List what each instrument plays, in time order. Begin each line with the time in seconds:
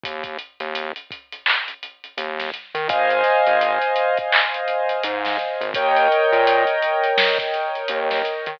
0.03 synth bass 1 D#2, kick, closed hi-hat
0.24 kick, closed hi-hat
0.39 closed hi-hat
0.60 synth bass 1 D#2, closed hi-hat
0.75 closed hi-hat
0.96 closed hi-hat
1.11 kick, closed hi-hat
1.32 closed hi-hat
1.46 clap
1.68 closed hi-hat
1.83 closed hi-hat
2.04 closed hi-hat
2.17 synth bass 1 D#2, closed hi-hat
2.39 snare, closed hi-hat
2.54 closed hi-hat
2.75 synth bass 1 D#3, closed hi-hat
2.89 synth bass 1 G#1, acoustic grand piano C5 D#5 F5 G#5, kick, closed hi-hat
3.10 closed hi-hat
3.24 snare, closed hi-hat
3.47 synth bass 1 G#1, closed hi-hat
3.61 closed hi-hat
3.82 closed hi-hat
3.96 closed hi-hat
4.17 kick, closed hi-hat
4.32 clap
4.54 closed hi-hat
4.68 closed hi-hat
4.89 closed hi-hat
5.03 synth bass 1 G#2, closed hi-hat
5.25 snare, closed hi-hat
5.39 closed hi-hat
5.61 synth bass 1 G#1, closed hi-hat
5.74 synth bass 1 D#2, acoustic grand piano A#4 C#5 D#5 G5, kick, closed hi-hat
5.96 closed hi-hat
6.12 closed hi-hat
6.32 synth bass 1 A#2, closed hi-hat
6.47 closed hi-hat
6.67 closed hi-hat
6.82 closed hi-hat
7.04 closed hi-hat
7.18 snare
7.38 kick, closed hi-hat
7.54 closed hi-hat
7.75 closed hi-hat
7.88 synth bass 1 D#2, closed hi-hat
8.11 snare, closed hi-hat
8.25 closed hi-hat
8.46 synth bass 1 D#3, closed hi-hat